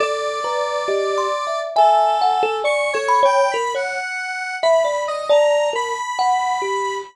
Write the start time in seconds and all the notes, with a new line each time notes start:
0.00 A4 D5
0.44 B4 A#5
0.88 G4 D#5
1.18 C6
1.47 E5
1.76 A4 E5 G#5
2.21 F#5
2.43 A4
2.64 D5 C#6
2.93 A4 C#5
3.08 B5
3.23 C#5 G5
3.51 A#4 B5
3.74 C#5 F#5
4.63 E5 B5
4.84 D5
5.08 D#5
5.29 D5 A5 A#5
5.73 A#4 B5
6.19 F#5
6.62 G4